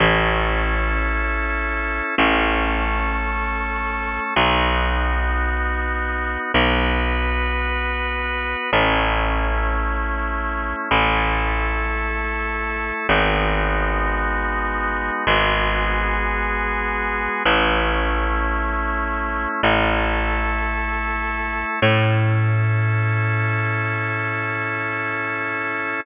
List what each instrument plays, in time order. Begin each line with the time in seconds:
0.00 electric bass (finger) A1, drawbar organ C#4 E4 A4
2.18 electric bass (finger) A1, drawbar organ A3 C#4 A4
4.36 electric bass (finger) B1, drawbar organ B3 D#4 F#4
6.54 electric bass (finger) B1, drawbar organ B3 F#4 B4
8.73 electric bass (finger) A1, drawbar organ A3 C#4 E4
10.91 electric bass (finger) A1, drawbar organ A3 E4 A4
13.09 electric bass (finger) G#1, drawbar organ G#3 B3 D#4 F#4
15.27 electric bass (finger) G#1, drawbar organ G#3 B3 F#4 G#4
17.45 electric bass (finger) A1, drawbar organ A3 C#4 E4
19.63 electric bass (finger) A1, drawbar organ A3 E4 A4
21.82 electric bass (finger) A2, drawbar organ C#4 E4 A4